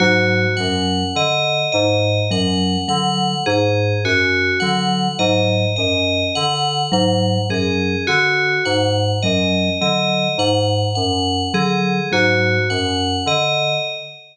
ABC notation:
X:1
M:3/4
L:1/8
Q:1/4=52
K:none
V:1 name="Electric Piano 2" clef=bass
^G,, ^F,, D, G,, F,, D, | ^G,, ^F,, D, G,, F,, D, | ^G,, ^F,, D, G,, F,, D, | ^G,, ^F,, D, G,, F,, D, |]
V:2 name="Vibraphone" clef=bass
^F, F, z2 F, F, | z2 ^F, F, z2 | ^F, F, z2 F, F, | z2 ^F, F, z2 |]
V:3 name="Tubular Bells"
^F ^f ^d d f f | ^G ^F ^f ^d d f | ^f ^G ^F f ^d d | ^f f ^G ^F f ^d |]